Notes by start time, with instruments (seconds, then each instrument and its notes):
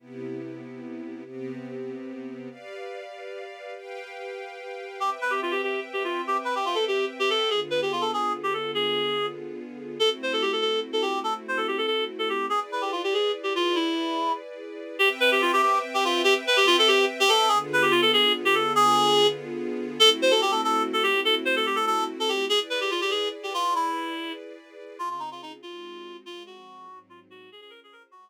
0.00 string ensemble 1 C3 B3 E4 G4
1.25 string ensemble 1 C3 B3 C4 G4
2.50 string ensemble 1 G4 B4 D5 F5
3.76 string ensemble 1 G4 B4 F5 G5
5.00 string ensemble 1 C4 B4 E5 G5, clarinet G4
5.21 clarinet B4
5.30 clarinet G4
5.42 clarinet F4
5.51 clarinet G4
5.63 clarinet G4
5.93 clarinet G4
6.04 clarinet F4
6.27 clarinet G4
6.45 clarinet B4
6.55 clarinet G4
6.65 clarinet F4
6.75 clarinet A4
6.88 clarinet G4
7.19 clarinet G4
7.30 clarinet A4
7.50 string ensemble 1 D3 B3 F4 G#4, clarinet G#4
7.70 clarinet B4
7.82 clarinet G4
7.92 clarinet F4
8.01 clarinet A4
8.13 clarinet G#4
8.43 clarinet G4
8.53 clarinet A4
8.75 clarinet G#4
9.99 string ensemble 1 A3 C4 E4 F#4, clarinet A4
10.23 clarinet C5
10.33 clarinet A4
10.42 clarinet G4
10.52 clarinet A4
10.61 clarinet A4
10.93 clarinet A4
11.02 clarinet G4
11.24 clarinet A4
11.48 clarinet C5
11.57 clarinet A4
11.68 clarinet G4
11.78 clarinet A4
11.87 clarinet A4
12.19 clarinet A4
12.29 clarinet G4
12.50 string ensemble 1 E4 G#4 B4 D5, clarinet G#4
12.72 clarinet B4
12.81 clarinet G4
12.92 clarinet F4
13.04 clarinet G4
13.14 clarinet G#4
13.43 clarinet G4
13.56 clarinet F4
13.75 clarinet E4
14.99 string ensemble 1 C4 B4 E5 G5, clarinet G4
15.20 clarinet B4
15.32 clarinet G4
15.42 clarinet F4
15.53 clarinet G4
15.62 clarinet G4
15.94 clarinet G4
16.05 clarinet F4
16.24 clarinet G4
16.47 clarinet B4
16.57 clarinet G4
16.67 clarinet F4
16.79 clarinet A4
16.88 clarinet G4
17.20 clarinet G4
17.29 clarinet A4
17.48 string ensemble 1 D3 B3 F4 G#4, clarinet G#4
17.73 clarinet B4
17.82 clarinet G4
17.91 clarinet F4
18.02 clarinet A4
18.13 clarinet G#4
18.45 clarinet G4
18.55 clarinet A4
18.75 clarinet G#4
20.00 string ensemble 1 A3 C4 E4 F#4, clarinet A4
20.22 clarinet C5
20.31 clarinet A4
20.42 clarinet G4
20.51 clarinet A4
20.64 clarinet A4
20.93 clarinet A4
21.03 clarinet G4
21.25 clarinet A4
21.45 clarinet C5
21.56 clarinet A4
21.66 clarinet G4
21.76 clarinet A4
21.87 clarinet A4
22.20 clarinet A4
22.29 clarinet G4
22.49 string ensemble 1 E4 G#4 B4 D5, clarinet G#4
22.70 clarinet B4
22.81 clarinet G4
22.91 clarinet F4
23.01 clarinet G4
23.11 clarinet G#4
23.43 clarinet G4
23.54 clarinet F4
23.75 clarinet E4
24.99 string ensemble 1 C#3 C4 F4 G#4, clarinet F4
25.10 clarinet F4
25.20 clarinet D#4
25.31 clarinet F4
25.42 clarinet D#4
25.63 string ensemble 1 G#3 C4 D#4 F#4, clarinet F4
26.25 string ensemble 1 F3 G#3 C4, clarinet F4
26.46 clarinet F#4
26.87 string ensemble 1 G#2 F#3 C4 D#4
27.10 clarinet F4
27.30 clarinet F#4
27.50 string ensemble 1 C#4 F4 G#4 C5, clarinet G#4
27.61 clarinet G#4
27.70 clarinet A#4
27.84 clarinet G#4
27.93 clarinet A#4
28.11 string ensemble 1 G#3 F#4 C5 D#5, clarinet F#4